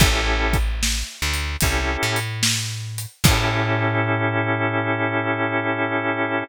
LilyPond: <<
  \new Staff \with { instrumentName = "Drawbar Organ" } { \time 4/4 \key a \major \tempo 4 = 74 <cis' e' g' a'>2 <cis' e' g' a'>2 | <cis' e' g' a'>1 | }
  \new Staff \with { instrumentName = "Electric Bass (finger)" } { \clef bass \time 4/4 \key a \major a,,4. d,8 c,8 a,4. | a,1 | }
  \new DrumStaff \with { instrumentName = "Drums" } \drummode { \time 4/4 \tuplet 3/2 { <cymc bd>8 r8 <hh bd>8 sn8 r8 hh8 <hh bd>8 r8 hh8 sn8 r8 hh8 } | <cymc bd>4 r4 r4 r4 | }
>>